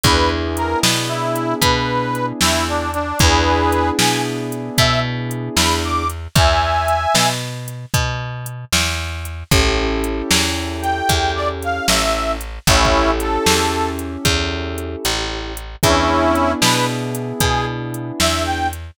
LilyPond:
<<
  \new Staff \with { instrumentName = "Harmonica" } { \time 12/8 \key e \major \tempo 4. = 76 b'8 r8 ais'8 r8 e'4 b'4. e'8 d'8 d'8 | <gis' b'>4. gis''8 r4 e''8 r4 b''8 d'''8 r8 | <e'' gis''>2 r1 | r2 r8 g''4 d''16 r16 f''8 e''4 r8 |
<cis' e'>4 a'4. r2. r8 | <cis' e'>4. b'8 r4 gis'8 r4 e''8 g''8 r8 | }
  \new Staff \with { instrumentName = "Acoustic Grand Piano" } { \time 12/8 \key e \major <b d' e' gis'>1. | <b d' e' gis'>1. | r1. | <cis' e' g' a'>1. |
<cis' e' g' a'>1. | <b d' e' gis'>1. | }
  \new Staff \with { instrumentName = "Electric Bass (finger)" } { \clef bass \time 12/8 \key e \major e,4. b,4. b,4. e,4. | e,4. b,4. b,4. e,4. | e,4. b,4. b,4. e,4. | a,,4. e,4. e,4. a,,4. |
a,,4. e,4. e,4. a,,4. | e,4. b,4. b,4. e,4. | }
  \new DrumStaff \with { instrumentName = "Drums" } \drummode { \time 12/8 <hh bd>4 hh8 sn4 hh8 <hh bd>4 hh8 sn4 hh8 | <hh bd>4 hh8 sn4 hh8 <hh bd>4 hh8 sn4 hh8 | <hh bd>4 hh8 sn4 hh8 <hh bd>4 hh8 sn4 hh8 | <hh bd>4 hh8 sn4 hh8 <hh bd>4 hh8 sn4 hh8 |
\tuplet 3/2 { <hh bd>16 r16 bd16 r16 r16 r16 hh16 r16 r16 } sn4 hh8 <hh bd>4 hh8 hh4 hh8 | <hh bd>4 hh8 sn4 hh8 <hh bd>4 hh8 sn4 hh8 | }
>>